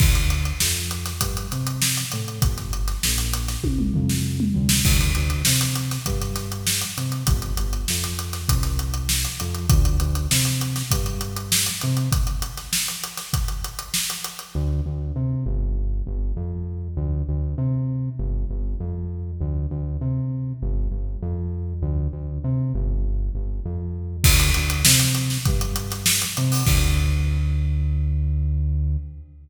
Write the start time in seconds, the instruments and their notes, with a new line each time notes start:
0.00 synth bass 1 D2, kick, crash
0.15 closed hi-hat
0.30 closed hi-hat
0.45 closed hi-hat
0.60 synth bass 1 F2, snare
0.91 closed hi-hat
1.06 snare, closed hi-hat
1.21 synth bass 1 G2, kick, closed hi-hat
1.37 closed hi-hat
1.51 synth bass 1 C3, snare, closed hi-hat
1.67 closed hi-hat
1.82 snare
1.97 closed hi-hat
2.12 synth bass 1 A2, snare, closed hi-hat
2.28 closed hi-hat
2.42 synth bass 1 G1, kick, closed hi-hat
2.58 snare, closed hi-hat
2.73 closed hi-hat
2.88 snare, closed hi-hat
3.03 synth bass 1 A#1, snare
3.18 closed hi-hat
3.33 closed hi-hat
3.48 snare, closed hi-hat
3.64 synth bass 1 C2, kick, high tom
3.79 mid tom
3.94 synth bass 1 F2, floor tom
4.09 snare
4.40 mid tom
4.55 synth bass 1 D2, floor tom
4.69 snare
4.85 synth bass 1 D2, kick, crash
5.01 closed hi-hat
5.15 synth bass 1 D2, closed hi-hat
5.30 closed hi-hat
5.45 synth bass 1 C3, snare
5.61 closed hi-hat
5.76 closed hi-hat
5.91 snare, closed hi-hat
6.06 synth bass 1 G2, kick, closed hi-hat
6.21 snare, closed hi-hat
6.36 snare, closed hi-hat
6.52 closed hi-hat
6.67 snare
6.81 closed hi-hat
6.97 synth bass 1 C3, snare, closed hi-hat
7.12 closed hi-hat
7.27 synth bass 1 G1, kick, closed hi-hat
7.42 closed hi-hat
7.57 synth bass 1 G1, closed hi-hat
7.73 closed hi-hat
7.88 synth bass 1 F2, snare
8.04 closed hi-hat
8.19 closed hi-hat
8.33 snare, closed hi-hat
8.49 synth bass 1 C2, kick, closed hi-hat
8.63 snare, closed hi-hat
8.79 closed hi-hat
8.94 closed hi-hat
9.09 snare
9.25 closed hi-hat
9.40 synth bass 1 F2, closed hi-hat
9.55 closed hi-hat
9.70 synth bass 1 D2, kick, closed hi-hat
9.85 closed hi-hat
10.00 synth bass 1 D2, closed hi-hat
10.15 closed hi-hat
10.31 synth bass 1 C3, snare
10.45 closed hi-hat
10.61 closed hi-hat
10.76 snare, closed hi-hat
10.91 synth bass 1 G2, kick, closed hi-hat
11.06 closed hi-hat
11.21 closed hi-hat
11.36 closed hi-hat
11.52 snare
11.66 closed hi-hat
11.81 synth bass 1 C3, closed hi-hat
11.97 closed hi-hat
12.12 kick, closed hi-hat
12.27 closed hi-hat
12.42 closed hi-hat
12.57 snare, closed hi-hat
12.73 snare
12.88 closed hi-hat
13.04 closed hi-hat
13.17 snare, closed hi-hat
13.33 kick, closed hi-hat
13.48 closed hi-hat
13.64 closed hi-hat
13.79 closed hi-hat
13.94 snare
14.10 closed hi-hat
14.24 closed hi-hat
14.39 closed hi-hat
14.55 synth bass 1 D2
14.86 synth bass 1 D2
15.16 synth bass 1 C3
15.46 synth bass 1 G1
16.07 synth bass 1 G1
16.36 synth bass 1 F2
16.97 synth bass 1 D2
17.29 synth bass 1 D2
17.58 synth bass 1 C3
18.19 synth bass 1 G1
18.50 synth bass 1 G1
18.80 synth bass 1 F2
19.41 synth bass 1 D2
19.71 synth bass 1 D2
20.01 synth bass 1 C3
20.62 synth bass 1 G1
20.91 synth bass 1 G1
21.22 synth bass 1 F2
21.82 synth bass 1 D2
22.13 synth bass 1 D2
22.44 synth bass 1 C3
22.74 synth bass 1 G1
23.35 synth bass 1 G1
23.65 synth bass 1 F2
24.24 synth bass 1 D2, kick, crash
24.40 closed hi-hat
24.54 synth bass 1 D2, closed hi-hat
24.70 closed hi-hat
24.85 synth bass 1 C3, snare
24.99 closed hi-hat
25.15 closed hi-hat
25.30 snare
25.45 synth bass 1 G2, kick, closed hi-hat
25.61 closed hi-hat
25.76 closed hi-hat
25.90 snare, closed hi-hat
26.06 snare
26.22 closed hi-hat
26.37 synth bass 1 C3, closed hi-hat
26.52 open hi-hat
26.67 synth bass 1 D2, kick, crash